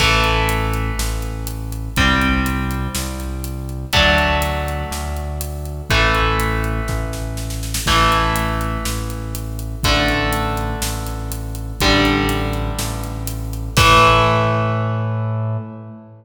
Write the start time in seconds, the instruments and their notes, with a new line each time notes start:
0.00 synth bass 1 A1, overdriven guitar E3 A3, kick, crash
0.24 closed hi-hat
0.49 closed hi-hat
0.73 closed hi-hat
0.99 synth bass 1 A1, snare
1.22 closed hi-hat
1.47 closed hi-hat
1.72 closed hi-hat
1.96 synth bass 1 C2, overdriven guitar G3 C4, kick, closed hi-hat
2.21 closed hi-hat
2.46 closed hi-hat
2.71 closed hi-hat
2.95 synth bass 1 C2, snare
3.20 closed hi-hat
3.44 closed hi-hat
3.69 closed hi-hat
3.93 synth bass 1 D2, overdriven guitar F#3 A3 D4, kick, closed hi-hat
4.18 closed hi-hat
4.42 closed hi-hat
4.68 closed hi-hat
4.91 synth bass 1 D2, snare
5.16 closed hi-hat
5.41 closed hi-hat
5.65 closed hi-hat
5.90 synth bass 1 A1, overdriven guitar E3 A3, kick, closed hi-hat
6.15 closed hi-hat
6.40 closed hi-hat
6.64 closed hi-hat
6.88 synth bass 1 A1, kick, snare
7.13 snare
7.37 snare
7.50 snare
7.63 snare
7.74 snare
7.86 synth bass 1 A1, overdriven guitar E3 A3, kick, crash
8.12 closed hi-hat
8.36 closed hi-hat
8.61 closed hi-hat
8.85 synth bass 1 A1, snare
9.10 closed hi-hat
9.35 closed hi-hat
9.59 closed hi-hat
9.83 synth bass 1 A1, overdriven guitar D3 A3, kick, closed hi-hat
10.08 closed hi-hat
10.33 closed hi-hat
10.57 closed hi-hat
10.82 synth bass 1 A1, snare
11.06 closed hi-hat
11.32 closed hi-hat
11.55 closed hi-hat
11.80 synth bass 1 A1, overdriven guitar D3 G3, kick, closed hi-hat
12.05 closed hi-hat
12.29 closed hi-hat
12.53 closed hi-hat
12.79 synth bass 1 A1, snare
13.03 closed hi-hat
13.27 closed hi-hat
13.53 closed hi-hat
13.77 synth bass 1 A2, overdriven guitar E3 A3, kick, crash